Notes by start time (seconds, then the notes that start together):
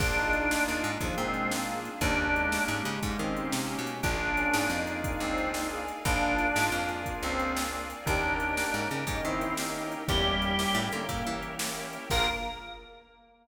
0.00 A#1 A#3 D4 F4 G#4, kick, crash
0.16 D#4
0.33 closed hi-hat
0.51 snare
0.68 D#2
0.84 G#2, closed hi-hat
1.00 D#2 F3 A#3 D4 F4 G#4, kick, closed hi-hat
1.17 A#2 G#3 C4
1.34 closed hi-hat
1.51 A#3, snare
1.85 closed hi-hat
2.01 D#2 A#3 C#4 D4 D#4 G4, kick, closed hi-hat
2.35 G#3, closed hi-hat
2.52 snare
2.68 G#2 G#3
2.85 C#3, closed hi-hat
3.03 G#2 A#3 C#4 D#4 G4, kick, closed hi-hat
3.19 D#3 C4
3.37 closed hi-hat
3.52 C3, snare
3.69 C#4
3.79 B2
3.87 closed hi-hat
4.03 A#1 A#3 D4 F4 G#4 A#4 D5 F5 G#5, kick, closed hi-hat
4.37 C#4, closed hi-hat
4.54 G#2, snare
4.70 F2 D#4
4.87 closed hi-hat
5.04 kick, closed hi-hat
5.20 C#2 C4
5.38 closed hi-hat
5.54 snare
5.72 G#4
5.88 closed hi-hat
6.05 A#1 A#3 D4 F4 G#4 A#4 D5 F5 G#5, kick, closed hi-hat
6.39 closed hi-hat
6.56 G#2, snare
6.72 F2
6.89 closed hi-hat
7.06 kick, closed hi-hat
7.23 C#2 C4
7.39 closed hi-hat
7.57 snare
7.90 closed hi-hat
8.05 D#2 A#3 C#4 D4 D#4 G4 A#4 C#5 D#5 G5, kick, closed hi-hat
8.23 A#4
8.40 closed hi-hat
8.57 A#3 C#4 D#4 G4, snare
8.74 G#2
8.91 C#3, closed hi-hat
9.07 G#2 A#3 C#4 D#4 G4, kick, closed hi-hat
9.24 D#3 C4 E4
9.41 closed hi-hat
9.57 A#3 C#4 D#4 G4, snare
9.92 closed hi-hat
10.08 E2 G3 A#3 C#4 E4 G4 A#4 C#5 E5 G5, kick, closed hi-hat
10.42 closed hi-hat
10.59 A#3 C#4 E4 G4, snare
10.75 A2
10.92 D3 A#3, closed hi-hat
11.09 A2 A#3 C#4 E4 G4, kick, closed hi-hat
11.27 E3
11.43 closed hi-hat
11.59 A#3 C#4 E4 G4, snare
11.93 closed hi-hat
12.10 A#1 A#3 D4 F4 G#4 A#4, kick, crash